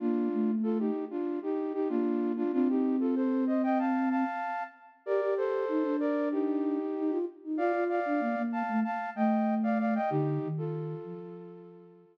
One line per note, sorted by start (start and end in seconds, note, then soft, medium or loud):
0.00 0.29 A#3 medium
0.00 0.51 D4 medium
0.00 0.51 F4 medium
0.32 0.90 A3 medium
0.63 0.78 F4 medium
0.63 0.78 A4 medium
0.79 1.05 D#4 medium
0.79 1.05 G4 medium
1.10 1.39 D4 medium
1.10 1.39 F4 medium
1.43 1.73 D#4 medium
1.43 1.73 G4 medium
1.73 1.88 D#4 medium
1.73 1.88 G4 medium
1.89 2.44 A#3 medium
1.89 2.32 D4 medium
1.89 2.32 F4 medium
2.37 2.52 D4 medium
2.37 2.52 F4 medium
2.53 4.24 C4 loud
2.53 2.68 D4 loud
2.53 2.68 F4 loud
2.69 2.96 D#4 medium
2.69 2.96 G4 medium
3.00 3.15 F4 medium
3.00 3.15 A4 medium
3.15 3.45 A4 medium
3.15 3.45 C5 medium
3.47 3.62 C5 medium
3.47 3.62 D#5 medium
3.63 3.78 D#5 medium
3.63 3.78 G5 medium
3.79 4.09 F5 medium
3.79 4.09 A5 medium
4.10 4.63 F5 medium
4.10 4.63 A5 medium
5.06 5.21 G4 medium
5.06 5.34 A#4 medium
5.06 5.34 D5 medium
5.22 5.65 G4 medium
5.37 5.96 A4 medium
5.37 5.96 C5 medium
5.68 5.83 D#4 medium
5.83 6.78 D4 medium
6.00 6.29 A#4 medium
6.00 6.29 D5 medium
6.31 7.18 D#4 medium
6.31 7.18 G4 medium
6.96 7.11 D#4 medium
7.10 7.25 F4 medium
7.44 7.59 D#4 medium
7.57 7.72 F4 medium
7.57 7.84 D5 medium
7.57 7.84 F5 medium
7.73 8.00 F4 medium
7.89 8.42 D5 medium
7.89 8.42 F5 medium
8.06 8.21 D4 medium
8.20 8.35 A#3 medium
8.36 8.63 A#3 medium
8.52 8.80 F5 medium
8.52 8.80 A5 medium
8.68 8.83 A3 medium
8.84 9.10 F5 medium
8.84 9.10 A5 medium
9.15 9.99 A3 medium
9.15 9.55 D#5 medium
9.15 9.55 G5 medium
9.63 9.78 D5 medium
9.63 9.78 F5 medium
9.79 9.94 D5 medium
9.79 9.94 F5 medium
9.95 10.10 D#5 medium
9.95 10.10 G5 medium
10.10 10.39 D3 loud
10.10 10.48 D#4 medium
10.10 10.48 G4 medium
10.43 10.95 D#3 medium
10.58 12.17 F4 medium
10.58 12.17 A4 medium
11.04 12.05 F3 medium